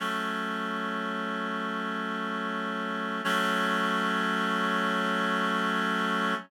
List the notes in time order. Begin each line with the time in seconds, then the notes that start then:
0.00 F#3 A3 C#4
3.24 F#3 A3 C#4